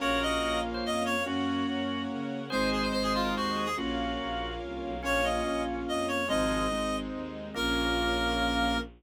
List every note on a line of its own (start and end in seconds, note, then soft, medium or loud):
0.00 0.38 A#1 medium
0.00 1.13 A#3 loud
0.00 1.13 C#4 loud
0.00 1.13 F4 loud
0.00 0.58 F#4 medium
0.00 1.24 A#4 medium
0.00 0.58 A#4 medium
0.00 1.24 C#5 medium
0.00 0.20 C#5 medium
0.00 1.24 F5 medium
0.22 0.60 D#5 medium
0.42 0.80 A#1 medium
0.74 0.84 C5 medium
0.85 1.23 F2 medium
0.85 1.03 D#5 medium
1.06 1.23 C#5 loud
1.26 1.63 F#2 medium
1.26 2.39 A#3 loud
1.26 2.39 C#4 loud
1.26 2.39 F#4 loud
1.26 2.02 F#4 medium
1.26 2.51 A#4 medium
1.26 2.51 C#5 loud
1.26 2.51 F#5 medium
1.68 2.06 F#2 medium
2.11 2.48 C#3 medium
2.50 2.89 G#1 medium
2.50 3.65 G#3 loud
2.50 3.65 C4 loud
2.50 3.65 D#4 loud
2.50 2.86 G#4 medium
2.50 3.77 G#4 medium
2.50 2.86 C5 medium
2.50 2.69 C5 medium
2.50 3.77 C5 medium
2.50 3.77 D#5 medium
2.72 2.82 G#4 medium
2.82 2.92 C5 medium
2.92 3.32 G#1 medium
2.92 3.02 C5 medium
2.92 3.23 C5 medium
3.03 3.13 G#4 medium
3.14 3.34 F4 medium
3.25 3.35 A#4 medium
3.36 3.74 D#2 medium
3.36 3.66 F#4 medium
3.36 3.58 C5 medium
3.56 3.75 G#4 medium
3.65 3.75 G#4 medium
3.77 4.15 A#1 medium
3.77 4.91 A#3 loud
3.77 4.91 C#4 loud
3.77 4.91 F4 loud
3.77 4.53 F#4 medium
3.77 5.02 A#4 medium
3.77 5.02 C#5 medium
3.77 5.02 F5 medium
4.19 4.57 A#1 medium
4.62 4.81 C2 medium
4.82 5.01 B1 medium
5.03 5.41 A#1 medium
5.03 5.41 A#3 loud
5.03 6.28 A#3 medium
5.03 5.21 C#4 medium
5.03 5.41 C#4 loud
5.03 6.28 C#4 medium
5.03 5.41 F4 loud
5.03 6.28 F4 medium
5.03 5.25 C#5 loud
5.24 5.80 C#4 medium
5.24 5.62 D#5 medium
5.46 5.83 A#1 medium
5.46 6.21 A#3 medium
5.46 6.21 C#4 medium
5.46 6.21 F4 medium
5.88 6.26 F2 medium
5.88 6.06 D#5 medium
6.08 6.27 C#5 medium
6.28 6.67 G#1 loud
6.28 6.64 F3 medium
6.28 6.64 G#3 medium
6.28 6.67 G#3 loud
6.28 7.54 G#3 medium
6.28 6.67 C4 loud
6.28 7.54 C4 medium
6.28 6.67 D#4 loud
6.28 7.54 D#4 medium
6.28 6.96 D#5 medium
6.71 7.09 G#1 medium
6.71 7.47 G#3 loud
6.71 7.47 C4 loud
6.71 7.47 D#4 medium
7.13 7.51 D#2 medium
7.54 8.78 A#1 loud
7.54 8.77 A#3 loud
7.54 8.78 A#3 loud
7.54 8.78 C#4 loud
7.54 8.78 F4 loud
7.54 8.78 A#4 loud